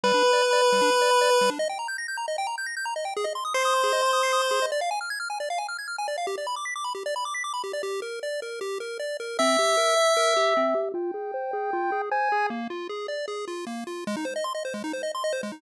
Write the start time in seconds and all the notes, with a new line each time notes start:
0.03 G3 B4
0.14 D4
0.23 B4
0.33 D5
0.42 B5
0.53 D5
0.62 B4
0.72 G3
0.82 D4
0.92 B4
1.02 D5
1.11 B5
1.21 D5
1.30 B4
1.41 G3
1.50 D4
1.59 D#5
1.69 G5
1.79 A#5
1.88 G6
1.98 A#6
2.08 G6
2.17 A#5
2.28 D#5
2.38 G5
2.47 A#5
2.58 G6
2.66 A#6
2.77 G6
2.85 A#5
2.96 D#5
3.05 G5
3.17 G#4
3.24 D#5
3.35 C6
3.45 D#6
3.54 C5 C7
3.65 D#6
3.74 C6
3.84 G#4
3.93 D#5
4.03 C6
4.13 D#6
4.23 C7
4.33 D#6
4.42 C6
4.51 G#4
4.62 D#5
4.72 D5
4.81 F5
4.91 G#5
5.01 F6
5.10 G#6
5.20 F6
5.30 G#5
5.40 D5
5.50 F5
5.58 G#5
5.69 F6
5.79 G#6
5.88 F6
5.98 G#5
6.08 D5
6.18 F5
6.27 G4
6.38 D5
6.47 B5
6.56 D6
6.65 B6
6.76 D6
6.84 B5
6.95 G4
7.06 D5
7.16 B5
7.25 D6
7.34 B6
7.44 D6
7.54 B5
7.64 G4
7.73 D5
7.83 G4
8.02 A#4
8.23 D5
8.42 A#4
8.61 G4
8.80 A#4
9.00 D5
9.20 A#4
9.39 C4 E5
9.59 G4
9.77 A#4
9.96 E5
10.17 A#4
10.37 G4
10.57 C4
10.75 G4
10.94 F4 G5
11.14 G#4
11.34 C5
11.53 G#4
11.73 F4
11.92 G#4
12.11 C5 G#5
12.32 G#4
12.50 A#3
12.70 F4
12.89 G#4
13.08 D5
13.28 G#4
13.48 F4
13.67 A#3
13.87 F4
14.07 G#3
14.17 D#4
14.25 C5
14.36 D#5
14.44 C6
14.55 D#5
14.65 C5
14.74 G#3
14.84 D#4
14.93 C5
15.03 D#5
15.15 C6
15.24 D#5
15.33 C5
15.43 G#3
15.52 D#4